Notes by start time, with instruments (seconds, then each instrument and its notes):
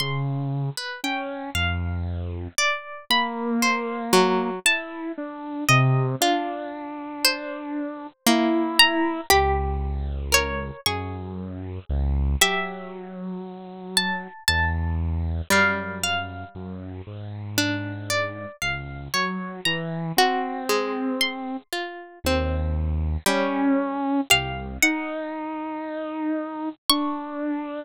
0.00 lead 2 (sawtooth) C#3, orchestral harp C6
0.77 orchestral harp B4
1.04 lead 2 (sawtooth) C#4, orchestral harp G5
1.55 lead 2 (sawtooth) F2, orchestral harp F5
2.58 orchestral harp D5
3.10 lead 2 (sawtooth) A#3, orchestral harp B5
3.62 orchestral harp C5
4.13 harpsichord F#3
4.66 lead 2 (sawtooth) E4, orchestral harp A5
5.18 lead 2 (sawtooth) D4
5.69 lead 2 (sawtooth) C3, orchestral harp D#5
6.21 lead 2 (sawtooth) D4, harpsichord F4
7.25 orchestral harp C5
8.27 harpsichord A#3, lead 2 (sawtooth) E4
8.79 orchestral harp A#5
9.30 lead 2 (sawtooth) C#2, harpsichord G4, orchestral harp B5
10.32 harpsichord A#4, orchestral harp C#5
10.86 lead 2 (sawtooth) F#2, harpsichord G#4, orchestral harp C#6
11.89 lead 2 (sawtooth) C#2
12.41 lead 2 (sawtooth) F#3, harpsichord G4, orchestral harp E5
13.97 orchestral harp A5
14.48 lead 2 (sawtooth) E2, orchestral harp A5
15.50 lead 2 (sawtooth) F#2, harpsichord G3, orchestral harp F5
16.03 orchestral harp F5
16.55 lead 2 (sawtooth) F#2
17.07 lead 2 (sawtooth) G#2
17.58 harpsichord D4
18.10 orchestral harp D5
18.62 lead 2 (sawtooth) C#2, orchestral harp F5
19.14 lead 2 (sawtooth) F#3, orchestral harp C#5
19.65 lead 2 (sawtooth) E3, orchestral harp A#5
20.17 lead 2 (sawtooth) C4, harpsichord F#4
20.69 harpsichord G#3
21.21 orchestral harp C6
21.73 harpsichord F4
22.24 lead 2 (sawtooth) D#2, harpsichord C4
23.26 harpsichord G3, lead 2 (sawtooth) C#4
24.30 lead 2 (sawtooth) C2, harpsichord G4, orchestral harp F5
24.83 lead 2 (sawtooth) D#4, orchestral harp F#5
26.89 lead 2 (sawtooth) D4, orchestral harp C#6